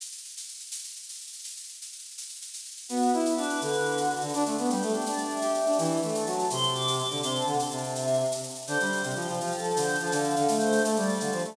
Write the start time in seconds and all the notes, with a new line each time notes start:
0.00 shaker
0.06 shaker
0.12 shaker
0.18 shaker
0.24 shaker
0.29 shaker
0.37 shaker
0.43 shaker
0.49 shaker
0.54 shaker
0.60 shaker
0.66 shaker
0.71 shaker
0.78 shaker
0.84 shaker
0.90 shaker
0.96 shaker
1.03 shaker
1.09 shaker
1.14 shaker
1.21 shaker
1.27 shaker
1.33 shaker
1.39 shaker
1.44 shaker
1.50 shaker
1.56 shaker
1.63 shaker
1.69 shaker
1.74 shaker
1.82 shaker
1.87 shaker
1.92 shaker
1.99 shaker
2.05 shaker
2.10 shaker
2.18 shaker
2.22 shaker
2.29 shaker
2.35 shaker
2.42 shaker
2.47 shaker
2.54 shaker
2.58 shaker
2.65 shaker
2.71 shaker
2.77 shaker
2.83 shaker
2.89 B3 F#4, shaker
2.96 shaker
3.02 shaker
3.08 shaker
3.13 E4, shaker
3.19 shaker
3.26 shaker
3.31 shaker
3.36 D4 B4, shaker
3.43 shaker
3.49 shaker
3.55 shaker
3.61 D3 B4, shaker
3.68 shaker
3.73 shaker
3.80 shaker
3.85 B4, shaker
3.91 shaker
3.97 F#4, shaker
4.04 shaker
4.10 F#4, shaker
4.16 shaker
4.21 D3 F#4, shaker
4.28 shaker
4.34 D4, shaker
4.40 shaker
4.46 A3, shaker
4.51 shaker
4.58 B3, shaker
4.65 shaker
4.69 G3 G4, shaker
4.76 shaker
4.82 A3, shaker
4.88 shaker
4.94 D4, shaker
5.01 shaker
5.06 D4 D5, shaker
5.12 shaker
5.18 shaker
5.25 shaker
5.29 E5, shaker
5.36 shaker
5.42 G4, shaker
5.49 shaker
5.54 E5, shaker
5.60 shaker
5.66 D4, shaker
5.72 shaker
5.78 E3, shaker
5.84 shaker
5.91 shaker
5.97 shaker
6.02 A3, shaker
6.08 shaker
6.13 A5, shaker
6.20 shaker
6.26 F#3, shaker
6.32 shaker
6.39 shaker
6.44 shaker
6.50 C3 C6, shaker
6.57 shaker
6.63 shaker
6.68 shaker
6.74 D6, shaker
6.81 shaker
6.88 shaker
6.93 shaker
6.99 D6, shaker
7.04 shaker
7.10 D3, shaker
7.17 shaker
7.22 C3 C6, shaker
7.28 shaker
7.35 A5, shaker
7.41 shaker
7.47 D3 F#5, shaker
7.53 shaker
7.59 A5, shaker
7.65 shaker
7.71 C3 A5, shaker
7.77 shaker
7.82 A5, shaker
7.89 shaker
7.95 E5, shaker
8.01 shaker
8.07 shaker
8.13 shaker
8.20 shaker
8.25 shaker
8.32 shaker
8.37 shaker
8.43 shaker
8.50 shaker
8.55 shaker
8.62 shaker
8.67 D3 C5, shaker
8.73 shaker
8.80 G3, shaker
8.86 shaker
8.92 shaker
8.97 shaker
9.03 C3, shaker
9.10 shaker
9.15 F3 G4, shaker
9.21 shaker
9.28 F3, shaker
9.33 shaker
9.40 F3 F4, shaker
9.46 shaker
9.52 A4, shaker
9.58 shaker
9.64 shaker
9.70 C5, shaker
9.76 D3, shaker
9.82 shaker
9.88 shaker
9.95 shaker
10.00 F3 A4, shaker
10.06 shaker
10.12 D3 F5, shaker
10.19 shaker
10.24 shaker
10.30 shaker
10.36 D3, shaker
10.42 shaker
10.48 A3, shaker
10.54 shaker
10.58 C5, shaker
10.66 shaker
10.72 shaker
10.78 shaker
10.83 A3 A4, shaker
10.91 shaker
10.96 G3 D5, shaker
11.02 shaker
11.09 shaker
11.14 shaker
11.20 D3 F5, shaker
11.26 shaker
11.32 F3, shaker
11.39 shaker
11.44 A3 D5, shaker
11.51 shaker